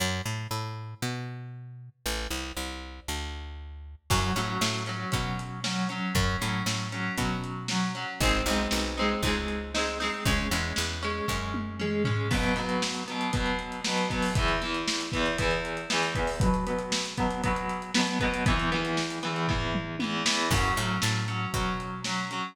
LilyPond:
<<
  \new Staff \with { instrumentName = "Overdriven Guitar" } { \time 4/4 \key fis \dorian \tempo 4 = 117 r1 | r1 | <fis cis'>8 <fis cis'>4 <fis cis'>8 <fis cis'>4 <fis cis'>8 <fis cis'>8 | <fis cis'>8 <fis cis'>4 <fis cis'>8 <fis cis'>4 <fis cis'>8 <fis cis'>8 |
<gis bis dis'>8 <gis bis dis'>4 <gis bis dis'>8 <gis bis dis'>4 <gis bis dis'>8 <gis bis dis'>8 | <gis cis'>8 <gis cis'>4 <gis cis'>8 <gis cis'>4 <gis cis'>8 <gis cis'>8 | \key b \dorian <b, fis b>8 <b, fis b>4 <b, fis b>8 <b, fis b>4 <b, fis b>8 <b, fis b>8 | <e, e b>8 <e, e b>4 <e, e b>8 <e, e b>4 <e, e b>8 <e, e b>8 |
<b, fis b>8 <b, fis b>4 <b, fis b>8 <b, fis b>4 <b, fis b>8 <b, fis b>8 | <e, e b>8 <e, e b>4 <e, e b>8 <e, e b>4 <e, e b>8 <e, e b>8 | \key fis \dorian <fis cis'>8 <fis cis'>4 <fis cis'>8 <fis cis'>4 <fis cis'>8 <fis cis'>8 | }
  \new Staff \with { instrumentName = "Electric Bass (finger)" } { \clef bass \time 4/4 \key fis \dorian fis,8 a,8 a,4 b,2 | a,,8 c,8 c,4 d,2 | fis,8 a,8 a,4 b,2 | fis,8 a,8 a,4 b,2 |
gis,,8 b,,8 b,,4 cis,2 | cis,8 e,8 e,4 fis,2 | \key b \dorian r1 | r1 |
r1 | r1 | \key fis \dorian fis,8 a,8 a,4 b,2 | }
  \new DrumStaff \with { instrumentName = "Drums" } \drummode { \time 4/4 r4 r4 r4 r4 | r4 r4 r4 r4 | <cymc bd>8 hh8 sn8 hh8 <hh bd>8 hh8 sn8 hh8 | <hh bd>8 hh8 sn8 hh8 <hh bd>8 hh8 sn8 hh8 |
<hh bd>8 hh8 sn8 hh8 <hh bd>8 hh8 sn8 hho8 | <hh bd>8 hh8 sn8 hh8 bd8 tommh8 toml8 tomfh8 | <cymc bd>16 hh16 hh16 hh16 sn16 hh16 hh16 hh16 <hh bd>16 hh16 hh16 hh16 sn16 hh16 <hh bd>16 hho16 | <hh bd>16 hh16 hh16 hh16 sn16 hh16 <hh bd>16 hh16 <hh bd>16 hh16 hh16 hh16 sn16 hh16 <hh bd>16 hho16 |
<hh bd>16 hh16 hh16 hh16 sn16 hh16 <hh bd>16 hh16 <hh bd>16 hh16 hh16 hh16 sn16 hh16 <hh bd>16 hh16 | <hh bd>16 hh16 hh16 hh16 sn16 hh16 hh16 hh16 <bd tomfh>8 toml8 tommh8 sn8 | <cymc bd>8 hh8 sn8 hh8 <hh bd>8 hh8 sn8 hh8 | }
>>